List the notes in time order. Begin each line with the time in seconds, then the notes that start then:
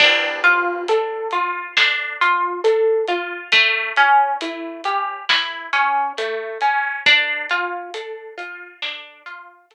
0.00 D4, kick, crash
0.44 F4, closed hi-hat
0.88 A4, closed hi-hat
1.31 F4, closed hi-hat
1.77 D4, snare
2.21 F4, closed hi-hat
2.64 A4, closed hi-hat
3.08 F4, closed hi-hat
3.52 A3, kick, closed hi-hat
3.96 C#4, closed hi-hat
4.41 E4, closed hi-hat
4.84 G4, closed hi-hat
5.29 E4, snare
5.73 C#4, closed hi-hat
6.18 A3, closed hi-hat
6.61 C#4, closed hi-hat
7.06 D4, kick, closed hi-hat
7.49 F4, closed hi-hat
7.94 A4, closed hi-hat
8.38 F4, closed hi-hat
8.82 D4, snare
9.26 F4, closed hi-hat
9.71 A4, closed hi-hat